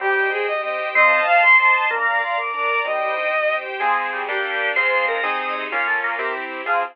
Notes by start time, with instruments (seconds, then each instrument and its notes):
0.00 acoustic grand piano C2 C4, drawbar organ G3, violin G4, string ensemble 1 C5 D#5 G5
0.16 acoustic grand piano G4
0.32 acoustic grand piano D#4, violin G#4
0.47 acoustic grand piano C2 G4, string ensemble 1 G4 C5 G5, violin D#5
0.63 acoustic grand piano C4, violin D#5
0.79 acoustic grand piano G4
0.95 acoustic grand piano A1 C4, drawbar organ C4, string ensemble 1 C5 D#5 F5 A5, violin D#5
1.11 acoustic grand piano D#4
1.27 acoustic grand piano F4, violin F5
1.42 acoustic grand piano A1 A4, string ensemble 1 C5 D#5 A5 C6, violin C6
1.58 acoustic grand piano C4, violin C6
1.74 acoustic grand piano D#4
1.90 acoustic grand piano A#1 D4, drawbar organ A#3, string ensemble 1 D5 F5 A#5, violin A#5
2.06 acoustic grand piano A#4
2.22 acoustic grand piano F4, violin C6
2.38 acoustic grand piano A#1 A#4, string ensemble 1 A#4 D5 A#5, violin D6
2.54 acoustic grand piano D4, violin D6
2.71 acoustic grand piano A#4
2.85 acoustic grand piano C2 C4, drawbar organ G3, string ensemble 1 C5 D#5 G5, violin D#5
3.01 acoustic grand piano G4
3.17 acoustic grand piano D#4
3.33 acoustic grand piano C2 G4, string ensemble 1 G4 C5 G5
3.50 acoustic grand piano C4
3.66 acoustic grand piano G4
3.80 acoustic grand piano F3 C4 G#4, string ensemble 1 F3 C4 G#4, drawbar organ G#3
4.13 drawbar organ G3
4.29 acoustic grand piano G3 A#3 D4, string ensemble 1 G3 A#3 D4, drawbar organ G4
4.76 string ensemble 1 G#2 F3 C4, acoustic grand piano G#3 C4 F4, drawbar organ C5
5.08 drawbar organ A#4
5.23 string ensemble 1 C3 G#3 D#4, acoustic grand piano C4 D#4 G#4, drawbar organ D#5
5.71 string ensemble 1 A#3 C#4 F4, acoustic grand piano A#3 C#4 F4, drawbar organ F4
5.87 drawbar organ A3
6.04 drawbar organ A#3
6.19 string ensemble 1 C4 E4 G4, acoustic grand piano C4 E4 G4
6.66 drawbar organ F3, acoustic grand piano C4 F4 G#4, string ensemble 1 C4 F4 G#4